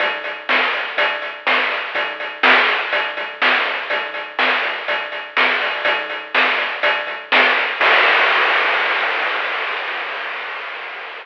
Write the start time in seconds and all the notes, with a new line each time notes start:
0.00 kick, closed hi-hat
0.24 closed hi-hat
0.49 snare
0.74 closed hi-hat
0.97 kick, closed hi-hat
1.22 closed hi-hat
1.47 snare
1.70 closed hi-hat
1.95 kick, closed hi-hat
2.20 closed hi-hat
2.43 snare
2.68 closed hi-hat
2.92 kick, closed hi-hat
3.17 kick, closed hi-hat
3.42 snare
3.66 closed hi-hat
3.90 kick, closed hi-hat
4.14 closed hi-hat
4.39 snare
4.63 closed hi-hat
4.88 kick, closed hi-hat
5.12 closed hi-hat
5.37 snare
5.61 open hi-hat
5.85 kick, closed hi-hat
6.10 closed hi-hat
6.35 snare
6.58 closed hi-hat
6.83 kick, closed hi-hat
7.07 kick, closed hi-hat
7.32 snare
7.57 closed hi-hat
7.80 kick, crash